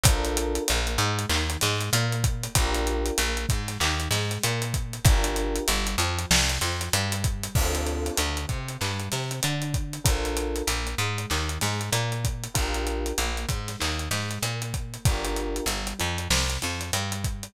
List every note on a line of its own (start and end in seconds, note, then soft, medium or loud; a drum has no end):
0.04 0.59 A#1 medium
0.04 0.62 D4 medium
0.04 0.62 F4 medium
0.04 0.62 A4 medium
0.04 0.62 A#4 medium
0.04 kick loud
0.04 closed hi-hat loud
0.25 closed hi-hat medium
0.37 closed hi-hat medium
0.55 closed hi-hat medium
0.68 0.98 A#1 medium
0.68 0.96 A#3 medium
0.68 closed hi-hat medium
0.87 closed hi-hat medium
0.98 1.26 G#2 medium
0.98 1.26 G#3 medium
0.98 closed hi-hat medium
1.19 closed hi-hat medium
1.29 1.57 D#2 medium
1.29 1.57 D#3 medium
1.29 clap loud
1.50 closed hi-hat medium
1.61 1.90 G#2 medium
1.61 1.90 G#3 medium
1.61 snare medium
1.61 closed hi-hat medium
1.81 closed hi-hat medium
1.93 2.48 A#2 medium
1.93 2.49 A#3 medium
1.93 closed hi-hat loud
2.12 closed hi-hat medium
2.24 kick medium
2.24 closed hi-hat medium
2.43 closed hi-hat medium
2.55 3.11 A#1 loud
2.55 3.13 D4 medium
2.55 3.13 F4 medium
2.55 3.13 G4 medium
2.55 3.13 A#4 medium
2.55 kick medium
2.55 closed hi-hat loud
2.74 closed hi-hat medium
2.87 closed hi-hat medium
3.06 closed hi-hat medium
3.17 3.46 A#1 medium
3.17 3.45 A#3 medium
3.17 closed hi-hat medium
3.37 closed hi-hat medium
3.49 3.78 G#2 medium
3.49 3.77 G#3 medium
3.49 kick medium
3.49 closed hi-hat medium
3.68 snare soft
3.68 closed hi-hat medium
3.80 4.08 D#2 medium
3.80 4.08 D#3 medium
3.80 clap loud
4.00 closed hi-hat medium
4.11 4.38 G#2 medium
4.11 4.41 G#3 medium
4.11 snare medium
4.11 closed hi-hat medium
4.31 closed hi-hat medium
4.43 4.99 A#2 medium
4.43 4.99 A#3 medium
4.43 closed hi-hat medium
4.62 closed hi-hat medium
4.74 kick medium
4.74 closed hi-hat medium
4.93 closed hi-hat medium
5.05 5.60 G1 medium
5.05 5.62 D4 medium
5.05 5.62 F4 medium
5.05 5.62 G4 medium
5.05 5.62 A#4 medium
5.05 kick loud
5.05 closed hi-hat loud
5.24 closed hi-hat medium
5.36 closed hi-hat medium
5.56 closed hi-hat medium
5.68 5.96 G1 medium
5.68 5.95 G3 medium
5.68 closed hi-hat medium
5.87 closed hi-hat medium
5.98 6.26 F2 medium
5.98 6.27 F3 medium
5.98 closed hi-hat medium
6.19 closed hi-hat medium
6.31 6.58 C2 medium
6.31 6.59 C3 medium
6.31 snare loud
6.49 closed hi-hat medium
6.61 6.89 F2 medium
6.61 6.91 F3 medium
6.61 snare medium
6.61 closed hi-hat medium
6.81 closed hi-hat medium
6.93 7.48 G2 medium
6.93 7.49 G3 medium
6.93 closed hi-hat medium
7.12 closed hi-hat medium
7.24 kick medium
7.24 closed hi-hat medium
7.43 closed hi-hat medium
7.55 8.10 D2 medium
7.55 8.13 C4 medium
7.55 8.13 D4 medium
7.55 8.13 F4 medium
7.55 8.13 A4 medium
7.55 kick medium
7.55 crash medium
7.75 closed hi-hat medium
7.87 closed hi-hat medium
8.06 closed hi-hat medium
8.17 8.46 D2 medium
8.17 8.46 D3 medium
8.17 closed hi-hat medium
8.37 closed hi-hat medium
8.48 8.77 C3 medium
8.48 8.76 C4 medium
8.48 kick medium
8.48 closed hi-hat medium
8.68 closed hi-hat medium
8.81 9.09 G2 medium
8.81 9.08 G3 medium
8.81 clap medium
9.00 closed hi-hat medium
9.12 9.40 C3 medium
9.12 9.39 C4 medium
9.12 snare soft
9.12 closed hi-hat medium
9.31 closed hi-hat medium
9.43 9.99 D3 medium
9.43 9.98 D4 medium
9.43 closed hi-hat medium
9.62 closed hi-hat medium
9.74 kick medium
9.74 closed hi-hat medium
9.93 closed hi-hat medium
10.04 10.62 A#1 medium
10.04 10.62 D4 medium
10.04 10.62 F4 medium
10.04 10.62 A4 medium
10.04 10.62 A#4 medium
10.04 kick medium
10.04 closed hi-hat loud
10.25 closed hi-hat medium
10.37 closed hi-hat medium
10.56 closed hi-hat medium
10.67 10.95 A#1 medium
10.67 10.95 A#3 medium
10.67 closed hi-hat medium
10.87 closed hi-hat medium
10.98 11.26 G#2 medium
10.98 11.27 G#3 medium
10.98 closed hi-hat medium
11.18 closed hi-hat medium
11.30 11.58 D#2 medium
11.30 11.58 D#3 medium
11.30 clap medium
11.49 closed hi-hat medium
11.61 11.90 G#2 medium
11.61 11.89 G#3 medium
11.61 snare medium
11.61 closed hi-hat medium
11.81 closed hi-hat medium
11.91 12.48 A#2 medium
11.91 12.47 A#3 medium
11.91 closed hi-hat medium
12.12 closed hi-hat medium
12.24 kick medium
12.24 closed hi-hat medium
12.44 closed hi-hat medium
12.54 13.13 A#1 medium
12.54 13.12 D4 medium
12.54 13.12 F4 medium
12.54 13.12 G4 medium
12.54 13.12 A#4 medium
12.54 kick medium
12.54 closed hi-hat medium
12.74 closed hi-hat medium
12.87 closed hi-hat medium
13.06 closed hi-hat medium
13.18 13.46 A#1 medium
13.18 13.47 A#3 medium
13.18 closed hi-hat medium
13.37 closed hi-hat medium
13.49 13.76 G#2 medium
13.49 13.77 G#3 medium
13.49 kick medium
13.49 closed hi-hat medium
13.68 snare soft
13.68 closed hi-hat medium
13.79 14.09 D#2 medium
13.79 14.07 D#3 medium
13.79 clap medium
13.99 closed hi-hat medium
14.11 14.39 G#2 medium
14.11 14.40 G#3 medium
14.11 snare medium
14.11 closed hi-hat medium
14.31 closed hi-hat medium
14.43 14.98 A#2 medium
14.43 15.00 A#3 medium
14.43 closed hi-hat medium
14.62 closed hi-hat medium
14.74 kick medium
14.74 closed hi-hat medium
14.94 closed hi-hat medium
15.05 15.61 G1 medium
15.05 15.64 D4 medium
15.05 15.64 F4 medium
15.05 15.64 G4 medium
15.05 15.64 A#4 medium
15.05 kick medium
15.05 closed hi-hat medium
15.25 closed hi-hat medium
15.36 closed hi-hat medium
15.56 closed hi-hat medium
15.66 15.94 G1 medium
15.66 15.95 G3 medium
15.66 closed hi-hat medium
15.87 closed hi-hat medium
15.99 16.28 F2 medium
15.99 16.26 F3 medium
15.99 closed hi-hat medium
16.18 closed hi-hat medium
16.30 16.58 C2 medium
16.30 16.58 C3 medium
16.30 snare medium
16.50 closed hi-hat medium
16.62 16.91 F2 medium
16.62 16.89 F3 medium
16.62 snare soft
16.62 closed hi-hat medium
16.81 closed hi-hat medium
16.93 17.48 G2 medium
16.93 17.49 G3 medium
16.93 closed hi-hat medium
17.12 closed hi-hat medium
17.24 kick medium
17.24 closed hi-hat medium
17.43 closed hi-hat medium